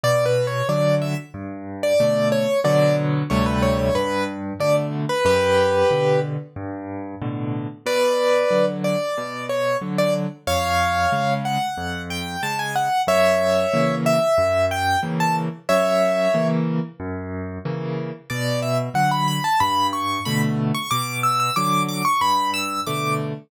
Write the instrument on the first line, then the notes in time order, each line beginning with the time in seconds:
acoustic grand piano
0.04 B2 D5
0.26 B4
0.47 C#5
0.69 D3 F#3 D5
1.02 E5
1.34 G2
1.83 D5
2.00 B2 D3 A3
2.32 C#5
2.64 B2 D3 F#3 D5
3.30 D2 C3 G3 A3 C#5
3.46 B4
3.63 C#5
3.79 C#5
3.95 G2 B4
4.60 B2 D3 A3 D5
5.09 B4
5.25 F#2 G4 B4
5.91 B2 D3
6.56 G2
7.22 A2 B2 D3
7.86 B2 B4 D5
8.51 D3 F#3
8.84 D5
9.18 B2
9.49 C#5
9.82 D3 F#3
9.98 D5
10.47 F2 C#5 F5
11.12 C#3 G#3
11.45 F#5
11.78 F2
12.10 G5
12.43 C#3 G#3 A5
12.59 G#5
12.76 F#5
13.07 F#2 C#5 E5
13.74 C#3 E3 A#3
14.06 E5
14.38 F#2
14.71 G5
15.03 C#3 E3 A#3
15.20 A5
15.69 F#2 C#5 E5
16.34 C#3 E3 A#3
17.00 F#2
17.65 C#3 E3 A#3
18.30 B2 D5
18.63 E5
18.94 D3 F#3 F#5
19.11 B5
19.28 B5
19.44 A5
19.60 G2 B5
19.93 C#6
20.25 B2 D3 A3 B5
20.75 C#6
20.91 B2 D6
21.23 E6
21.40 E6
21.56 D3 F#3 D6
21.89 D6
22.05 C#6
22.21 G2 B5
22.54 E6
22.87 B2 D3 A3 D6